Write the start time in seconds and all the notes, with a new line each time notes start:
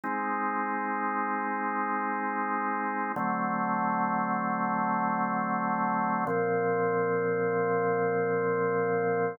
0.04 G#3 C4 D#4
3.16 D3 F#3 A3 C4
6.27 A#2 F3 C4